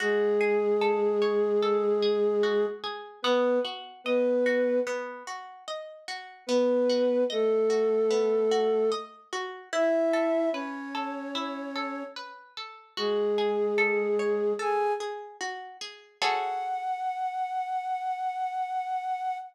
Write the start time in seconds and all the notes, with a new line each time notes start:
0.00 G#3 F#4 G#4
0.41 G#4
0.81 A4
1.22 C#5
1.63 A4
2.02 G#4
2.43 F#4
2.84 G#4
3.22 B3 B4
3.65 F#4
4.04 B3 B4 D#5
4.46 F#4
4.87 B3
5.27 F#4
5.68 D#5
6.08 F#4
6.47 B3 B4
6.90 F#4
7.30 A3 A4 D#5
7.70 F#4
8.10 B3
8.51 F#4
8.92 D#5
9.33 F#4
9.73 E4 E5
10.13 A4
10.52 C#4 B4 C#5
10.95 A4
11.35 E4
11.76 A4
12.16 B4
12.57 A4
12.97 G#3 F#4 G#4
13.38 G#4
13.78 A4
14.19 C#5
14.59 G#4 A4 G#5
15.00 G#4
15.41 F#4
15.81 G#4
16.21 F#4 G#4 A4 C#5 F#5